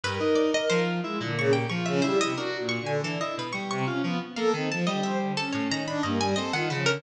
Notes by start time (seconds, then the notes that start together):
0.03 G2 A#4 B4
0.20 D#4
0.35 D5
0.54 D#5
0.70 F3 C5
1.03 G#3 E4
1.20 A#2 D3
1.37 C#3 C#6
1.53 G4 G5
1.69 F3 F4 C#6
1.86 C#3 E5
2.02 G3 E4 C5
2.20 C3 D#5
2.37 D4 F#4 A#4
2.59 A#2
2.69 C#6
2.81 D3
2.86 G#5
3.03 E3 D4 A4
3.20 E4 D#5
3.37 B2 B4
3.53 G3 C#6
3.70 C3 C#6
3.87 C#4 F4
4.03 F3 B3
4.36 A#3 A4 F5
4.53 D#3 C4
4.70 F3 A5
4.87 D3 G3 D#5
5.03 C5 E5
5.20 D3
5.37 C#4 A4
5.53 A2 C#5
5.70 D#3 A#5
5.87 D4 B5
6.03 G2 A#3 D#5
6.20 G3 G#5
6.36 C4 A4 D#5
6.53 D#3 F4 F#5
6.70 C#3 F3 B4
6.86 D3 A#4